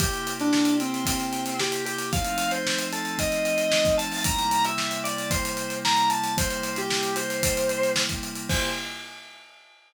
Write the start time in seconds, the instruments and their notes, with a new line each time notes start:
0.00 pad 5 (bowed) C3 A#3 E4 G4, distortion guitar G4, kick, closed hi-hat
0.13 closed hi-hat
0.27 closed hi-hat
0.40 distortion guitar D4, closed hi-hat
0.53 snare
0.65 closed hi-hat
0.80 distortion guitar C4, closed hi-hat
0.94 closed hi-hat
1.05 distortion guitar C4, kick, closed hi-hat
1.20 closed hi-hat
1.33 closed hi-hat
1.46 closed hi-hat
1.59 distortion guitar G4, snare
1.72 closed hi-hat
1.86 distortion guitar G4, closed hi-hat
1.98 closed hi-hat
2.13 pad 5 (bowed) F3 A3 C4 D#4, distortion guitar F5, kick, closed hi-hat
2.25 closed hi-hat
2.38 closed hi-hat
2.51 distortion guitar C5, closed hi-hat
2.67 snare
2.79 closed hi-hat
2.93 distortion guitar A4, closed hi-hat
3.05 closed hi-hat
3.18 distortion guitar D#5, kick, closed hi-hat
3.32 closed hi-hat
3.45 closed hi-hat
3.58 closed hi-hat
3.70 distortion guitar D#5, snare
3.85 kick, closed hi-hat
3.98 distortion guitar A5, closed hi-hat
4.12 open hi-hat
4.24 pad 5 (bowed) C3 G3 A#3 E4, distortion guitar A#5, kick, closed hi-hat
4.39 closed hi-hat
4.51 closed hi-hat
4.65 distortion guitar E5, closed hi-hat
4.78 snare
4.91 closed hi-hat
5.04 distortion guitar D5, closed hi-hat
5.18 closed hi-hat
5.31 distortion guitar C5, kick, closed hi-hat
5.45 closed hi-hat
5.57 closed hi-hat
5.70 closed hi-hat
5.85 distortion guitar A#5, snare
5.97 closed hi-hat
6.09 distortion guitar A5, closed hi-hat
6.24 closed hi-hat
6.37 pad 5 (bowed) C3 G3 A#3 E4, distortion guitar C5, kick, closed hi-hat
6.50 closed hi-hat
6.63 closed hi-hat
6.76 distortion guitar G4, closed hi-hat
6.90 snare
7.03 closed hi-hat
7.16 distortion guitar C5, closed hi-hat
7.30 closed hi-hat
7.43 kick, closed hi-hat
7.57 closed hi-hat
7.69 closed hi-hat
7.83 closed hi-hat
7.96 snare
8.09 kick, closed hi-hat
8.23 closed hi-hat
8.36 closed hi-hat
8.49 pad 5 (bowed) C3 A#3 E4 G4, distortion guitar C5, kick, crash